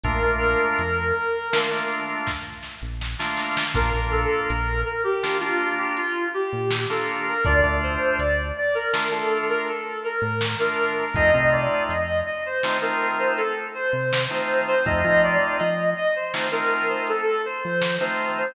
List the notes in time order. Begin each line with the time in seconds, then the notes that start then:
0.03 A#1 A3 A#3 D4 F4 A#4, kick, closed hi-hat
0.22 A#1 A3 A#3 D4 F4
0.79 F2, closed hi-hat
1.52 A3 A#3 D4 F4, snare
1.71 A3 A#3 D4 F4
2.27 kick, snare
2.63 snare
2.82 A#1
3.01 snare
3.19 A3 A#3 D4 F4, snare
3.37 snare
3.57 snare
3.74 A#1 A#3 D4 F4 A#4, kick, crash
3.93 A#1 A#3 D4 F4
4.11 A4
4.48 A#1 A#4, closed hi-hat
4.85 A#4
5.04 G4
5.23 A#3 D4 F4, snare
5.40 A#3 D4 F4
5.78 G4
5.97 F4, closed hi-hat
6.34 G4
6.53 A#2
6.71 snare
6.90 A#3 D4 F4 A4
7.28 A#4
7.45 D2 A3 D4 F4 D5, kick, closed hi-hat
7.64 D2 A3 D4 F4
7.83 C5
8.18 D2 D5, closed hi-hat
8.57 D5
8.75 A#4
8.93 A3 D4 F4, snare
9.10 A3 D4 F4 A4
9.49 A#4
9.67 A4, closed hi-hat
10.04 A#4
10.22 A2
10.41 snare
10.59 A3 D4 F4 A#4
10.97 A#4
11.15 F2 A3 C4 D#4 F4 D#5, kick, closed hi-hat
11.34 C3 A3 C4 D#4 F4
11.52 D5
11.89 F2 D#5, closed hi-hat
12.26 D#5
12.46 C5
12.63 A3 C4 D#4 F4, snare
12.81 A3 C4 D#4 F4 A#4
13.19 C5
13.37 A4, closed hi-hat
13.74 C5
13.93 C3
14.13 snare
14.30 A3 C4 D#4 F4 C5
14.67 C5
14.85 F2 A3 C4 D#4 F4 D#5, kick, closed hi-hat
15.04 F3 A3 C4 D#4 F4
15.23 D5
15.59 F3 D#5, closed hi-hat
15.97 D#5
16.16 C5
16.34 A3 C4 D#4 F4, snare
16.51 A3 C4 D#4 F4 A#4
16.89 C5
17.07 A4, closed hi-hat
17.45 C5
17.65 F3
17.81 snare
18.00 A3 C4 D#4 F4 C5
18.37 C5